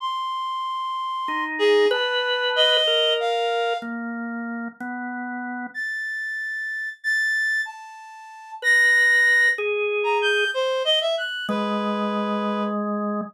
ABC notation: X:1
M:6/8
L:1/16
Q:3/8=63
K:none
V:1 name="Drawbar Organ"
z8 _E4 | B6 _B6 | _B,6 =B,6 | z12 |
z6 B6 | _A6 z6 | _A,12 |]
V:2 name="Clarinet"
c'10 _A2 | a4 _e4 f4 | z12 | a'8 a'4 |
a6 _b'6 | z3 _b g'2 c2 _e =e _g'2 | B8 z4 |]